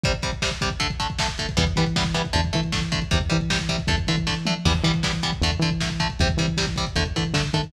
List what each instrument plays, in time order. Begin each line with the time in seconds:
0.04 overdriven guitar C3 G3, kick, closed hi-hat
0.13 kick, closed hi-hat
0.22 overdriven guitar C3 G3, kick, closed hi-hat
0.32 kick, closed hi-hat
0.42 overdriven guitar C3 G3, kick, snare
0.51 kick, closed hi-hat
0.61 overdriven guitar C3 G3, kick, closed hi-hat
0.70 kick, closed hi-hat
0.80 overdriven guitar D3 A3, kick, closed hi-hat
0.90 kick, closed hi-hat
1.00 overdriven guitar D3 A3, kick, closed hi-hat
1.10 kick, closed hi-hat
1.19 overdriven guitar D3 A3, kick, snare
1.28 kick, closed hi-hat
1.38 overdriven guitar D3 A3, kick, closed hi-hat
1.49 kick, closed hi-hat
1.57 synth bass 1 E2, overdriven guitar E3 G3 B3, kick, closed hi-hat
1.66 kick, closed hi-hat
1.76 overdriven guitar E3 G3 B3, synth bass 1 E3, kick, closed hi-hat
1.86 kick, closed hi-hat
1.96 overdriven guitar E3 G3 B3, kick, snare
2.05 kick, closed hi-hat
2.14 overdriven guitar E3 G3 B3, kick, closed hi-hat
2.25 kick, closed hi-hat
2.33 synth bass 1 E2, overdriven guitar D3 A3, kick, closed hi-hat
2.44 kick, closed hi-hat
2.53 overdriven guitar D3 A3, synth bass 1 E3, kick, closed hi-hat
2.63 kick, closed hi-hat
2.72 overdriven guitar D3 A3, kick, snare
2.82 kick, closed hi-hat
2.92 overdriven guitar D3 A3, kick, closed hi-hat
3.02 kick, closed hi-hat
3.11 synth bass 1 E2, overdriven guitar C3 G3, kick, closed hi-hat
3.21 kick, closed hi-hat
3.30 overdriven guitar C3 G3, synth bass 1 E3, kick, closed hi-hat
3.41 kick, closed hi-hat
3.50 overdriven guitar C3 G3, kick, snare
3.59 kick, closed hi-hat
3.69 overdriven guitar C3 G3, kick, closed hi-hat
3.78 kick, closed hi-hat
3.87 synth bass 1 E2, overdriven guitar D3 A3, kick, closed hi-hat
3.97 kick, closed hi-hat
4.07 overdriven guitar D3 A3, synth bass 1 E3, kick, closed hi-hat
4.16 kick, closed hi-hat
4.27 overdriven guitar D3 A3, kick, snare
4.46 overdriven guitar D3 A3, mid tom
4.65 synth bass 1 E2, overdriven guitar E3 G3 B3, kick, crash
4.74 kick, closed hi-hat
4.83 synth bass 1 E3, overdriven guitar E3 G3 B3, kick, closed hi-hat
4.94 kick, closed hi-hat
5.03 overdriven guitar E3 G3 B3, kick, snare
5.13 kick, closed hi-hat
5.23 overdriven guitar E3 G3 B3, kick, closed hi-hat
5.32 kick, closed hi-hat
5.41 synth bass 1 E2, overdriven guitar D3 A3, kick, closed hi-hat
5.52 kick, closed hi-hat
5.59 overdriven guitar D3 A3, synth bass 1 E3, kick, closed hi-hat
5.71 kick, closed hi-hat
5.81 overdriven guitar D3 A3, kick, snare
5.90 kick, closed hi-hat
6.00 overdriven guitar D3 A3, kick, closed hi-hat
6.09 kick, closed hi-hat
6.19 synth bass 1 E2, overdriven guitar C3 G3, kick, closed hi-hat
6.29 kick, closed hi-hat
6.37 overdriven guitar C3 G3, synth bass 1 E3, kick, closed hi-hat
6.47 kick, closed hi-hat
6.57 overdriven guitar C3 G3, kick, snare
6.67 kick, closed hi-hat
6.76 overdriven guitar C3 G3, kick, closed hi-hat
6.87 kick, closed hi-hat
6.96 synth bass 1 E2, overdriven guitar D3 A3, kick, closed hi-hat
7.05 kick, closed hi-hat
7.16 overdriven guitar D3 A3, synth bass 1 E3, kick, closed hi-hat
7.25 kick, closed hi-hat
7.33 synth bass 1 D3, overdriven guitar D3 A3, kick, snare
7.44 kick, closed hi-hat
7.53 overdriven guitar D3 A3, synth bass 1 D#3, kick, closed hi-hat
7.63 kick, closed hi-hat